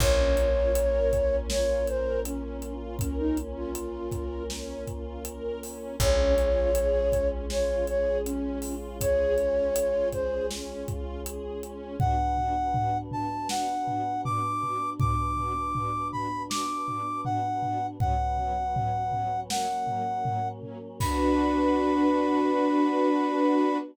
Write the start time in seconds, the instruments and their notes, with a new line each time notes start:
0.00 electric bass (finger) A#1, choir aahs A#3 C#4 F4, string ensemble 1 C#4, flute C#5, kick, crash
0.37 string ensemble 1 F4, closed hi-hat
0.75 string ensemble 1 A#4, closed hi-hat
1.13 string ensemble 1 C#4, kick, closed hi-hat
1.49 string ensemble 1 F4, flute C#5, snare
1.87 string ensemble 1 A#4, flute C5, closed hi-hat
2.23 string ensemble 1 C#4, flute C#4, closed hi-hat
2.62 string ensemble 1 F4, closed hi-hat
2.99 flute C#4, string ensemble 1 A#4, kick, closed hi-hat
3.19 flute D#4
3.37 string ensemble 1 C#4, closed hi-hat
3.57 flute F4
3.75 string ensemble 1 F4, closed hi-hat
4.12 string ensemble 1 A#4, kick, closed hi-hat
4.50 string ensemble 1 C#4, snare
4.87 string ensemble 1 F4, kick, closed hi-hat
5.25 string ensemble 1 A#4, closed hi-hat
5.62 string ensemble 1 C#4, open hi-hat
6.00 electric bass (finger) A#1, choir aahs G#3 C#4 F4, string ensemble 1 C#4, flute C#5, kick, closed hi-hat
6.37 string ensemble 1 F4, closed hi-hat
6.75 string ensemble 1 G#4, closed hi-hat
7.12 string ensemble 1 C#4, kick, closed hi-hat
7.50 string ensemble 1 F4, flute C#5, snare
7.87 string ensemble 1 G#4, flute C#5, closed hi-hat
8.25 string ensemble 1 C#4, flute C#4, closed hi-hat
8.62 string ensemble 1 F4, open hi-hat
9.00 string ensemble 1 G#4, flute C#5, kick, closed hi-hat
9.37 string ensemble 1 C#4, closed hi-hat
9.75 string ensemble 1 F4, closed hi-hat
10.12 string ensemble 1 G#4, flute C5, kick, closed hi-hat
10.51 string ensemble 1 C#4, snare
10.86 string ensemble 1 F4, kick, closed hi-hat
11.25 string ensemble 1 G#4, closed hi-hat
11.62 string ensemble 1 C#4, closed hi-hat
12.00 string ensemble 1 B3 D4 F#4, choir aahs B3 D4 F#4, brass section F#5, kick, floor tom
12.37 string ensemble 1 B3 D4 F#4, floor tom
12.74 string ensemble 1 B3 D4 F#4, floor tom
13.11 string ensemble 1 B3 D4 F#4, brass section A5, floor tom
13.49 string ensemble 1 B3 D4 F#4, brass section F#5, snare
13.86 string ensemble 1 B3 D4 F#4, floor tom
14.25 string ensemble 1 B3 D4 F#4, brass section D6, floor tom
14.63 string ensemble 1 B3 D4 F#4, floor tom
15.00 string ensemble 1 B3 D4 F#4, brass section D6, kick, floor tom
15.37 string ensemble 1 B3 D4 F#4, floor tom
15.75 string ensemble 1 B3 D4 F#4, floor tom
16.12 string ensemble 1 B3 D4 F#4, brass section B5, floor tom
16.50 string ensemble 1 B3 D4 F#4, brass section D6, snare
16.86 string ensemble 1 B3 D4 F#4, floor tom
17.25 string ensemble 1 B3 D4 F#4, brass section F#5, floor tom
17.62 string ensemble 1 B3 D4 F#4, floor tom
17.99 string ensemble 1 F#3 B3 C#4, choir aahs F#3 B3 C#4, brass section F#5, kick, floor tom
18.38 string ensemble 1 F#3 B3 C#4, floor tom
18.74 string ensemble 1 F#3 B3 C#4, floor tom
19.12 string ensemble 1 F#3 B3 C#4, floor tom
19.50 choir aahs F#3 A#3 C#4, string ensemble 1 F#3 A#3 C#4, brass section F#5, snare
19.87 string ensemble 1 F#3 A#3 C#4, floor tom
20.23 string ensemble 1 F#3 A#3 C#4, floor tom
20.62 string ensemble 1 F#3 A#3 C#4, floor tom
21.00 choir aahs B3 D4 F#4, string ensemble 1 D4 F#4 B4, brass section B5, kick, crash